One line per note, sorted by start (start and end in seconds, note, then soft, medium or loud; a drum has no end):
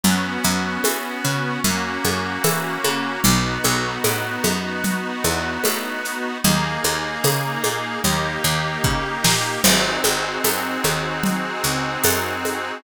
0.04 0.38 F#2 medium
0.04 1.60 B3 medium
0.04 1.60 C#4 medium
0.04 1.60 F#4 medium
0.04 low conga medium
0.04 shaker medium
0.44 0.79 F#2 medium
0.44 shaker medium
0.84 1.19 E3 medium
0.84 tambourine medium
0.84 high conga medium
0.84 shaker medium
1.25 1.59 C#3 medium
1.25 shaker medium
1.64 1.98 F#2 medium
1.64 3.21 A#3 medium
1.64 3.21 C#4 medium
1.64 3.21 F#4 medium
1.64 low conga medium
1.64 shaker medium
2.04 2.39 F#2 medium
2.04 high conga medium
2.04 shaker medium
2.44 2.78 E3 medium
2.44 tambourine medium
2.44 high conga medium
2.44 shaker medium
2.84 3.19 C#3 medium
2.84 high conga medium
2.84 shaker medium
3.24 3.59 B1 medium
3.24 6.38 B3 medium
3.24 6.38 D#4 medium
3.24 6.38 F#4 medium
3.24 low conga medium
3.24 shaker medium
3.64 3.99 B1 medium
3.64 high conga medium
3.64 shaker medium
4.04 4.38 A2 medium
4.04 tambourine medium
4.04 high conga medium
4.04 shaker medium
4.44 5.12 F#2 medium
4.44 high conga medium
4.44 shaker medium
4.84 low conga medium
4.84 shaker medium
5.24 5.58 E2 medium
5.24 high conga medium
5.24 shaker medium
5.64 6.33 A2 medium
5.64 tambourine medium
5.64 high conga medium
5.64 shaker medium
6.05 shaker medium
6.44 6.78 D#2 medium
6.44 8.01 A#3 loud
6.44 8.01 D#4 medium
6.44 8.01 G#4 medium
6.44 low conga medium
6.44 shaker medium
6.84 7.18 D#2 medium
6.84 high conga medium
6.84 shaker medium
7.24 7.58 C#3 medium
7.24 tambourine medium
7.24 high conga medium
7.24 shaker medium
7.64 7.98 A#2 medium
7.64 high conga medium
7.64 shaker medium
8.04 8.38 D#2 medium
8.04 9.62 A#3 medium
8.04 9.62 D#4 medium
8.04 9.62 G4 medium
8.04 low conga medium
8.04 shaker medium
8.44 8.78 D#2 medium
8.44 shaker medium
8.84 9.18 C#3 medium
8.84 kick medium
9.24 9.58 A#2 medium
9.24 snare medium
9.64 9.98 G#1 medium
9.64 12.79 C4 medium
9.64 12.79 D#4 medium
9.64 12.79 F#4 medium
9.64 12.79 G#4 medium
9.64 crash loud
9.64 low conga medium
9.64 shaker medium
10.04 10.38 G#1 medium
10.04 high conga medium
10.04 shaker medium
10.44 10.78 F#2 medium
10.44 tambourine medium
10.44 high conga medium
10.44 shaker medium
10.84 11.52 D#2 medium
10.84 high conga medium
10.84 shaker medium
11.24 low conga medium
11.24 shaker medium
11.64 11.98 C#2 medium
11.64 shaker medium
12.04 12.72 F#2 medium
12.04 tambourine medium
12.04 high conga medium
12.04 shaker medium
12.45 high conga medium
12.45 shaker medium